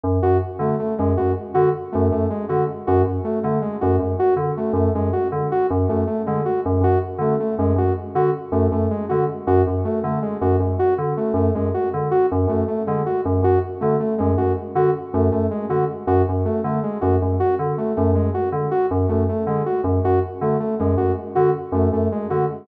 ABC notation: X:1
M:5/4
L:1/8
Q:1/4=159
K:none
V:1 name="Electric Piano 2" clef=bass
_G,, G,, z D, z G,, G,, z D, z | _G,, G,, z D, z G,, G,, z D, z | _G,, G,, z D, z G,, G,, z D, z | _G,, G,, z D, z G,, G,, z D, z |
_G,, G,, z D, z G,, G,, z D, z | _G,, G,, z D, z G,, G,, z D, z | _G,, G,, z D, z G,, G,, z D, z | _G,, G,, z D, z G,, G,, z D, z |
_G,, G,, z D, z G,, G,, z D, z | _G,, G,, z D, z G,, G,, z D, z | _G,, G,, z D, z G,, G,, z D, z | _G,, G,, z D, z G,, G,, z D, z |]
V:2 name="Lead 2 (sawtooth)"
z _G z A, A, _A, G z G z | A, A, _A, _G z G z =A, A, _A, | _G z G z A, A, _A, G z G | z A, A, _A, _G z G z =A, A, |
_A, _G z G z =A, A, _A, G z | _G z A, A, _A, G z G z =A, | A, _A, _G z G z =A, A, _A, G | z _G z A, A, _A, G z G z |
A, A, _A, _G z G z =A, A, _A, | _G z G z A, A, _A, G z G | z A, A, _A, _G z G z =A, A, | _A, _G z G z =A, A, _A, G z |]